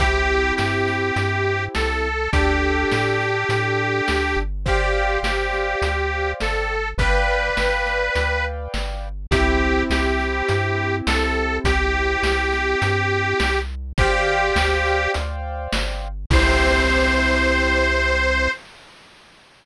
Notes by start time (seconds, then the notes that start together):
0.00 C2 C4 E4 G4, kick, closed hi-hat
0.57 G2 G4, snare
0.88 snare
1.16 G2, closed hi-hat
1.75 C2 A4, snare
2.33 D2 D4 G4 A4, kick, closed hi-hat
2.92 A2, snare
3.20 snare
3.49 A2, closed hi-hat
4.08 D2, snare
4.37 G1
4.66 G4 C5 D5 F5 G5, kick, closed hi-hat
5.23 G1 G4, snare
5.53 snare
5.82 D2, closed hi-hat
6.40 G1 A4, snare
6.98 G1 B4 D5 F5 G5, kick, closed hi-hat
7.57 G1, snare
7.86 snare
8.15 D2, closed hi-hat
8.74 G1, snare
9.31 C2 C4 E4 G4, kick, closed hi-hat
9.90 C2 G4, snare
10.20 snare
10.49 G2, closed hi-hat
11.07 C2 A4, snare
11.64 C2 G4, kick, closed hi-hat
12.23 C2, snare
12.53 snare
12.82 G2, closed hi-hat
13.40 C2, snare
13.98 G1 G4 C5 D5 F5 G5, kick, closed hi-hat
14.56 D2, snare
14.86 snare
15.14 D2, closed hi-hat
15.73 G1, snare
16.30 C2 C4 E4 G4 C5, kick, crash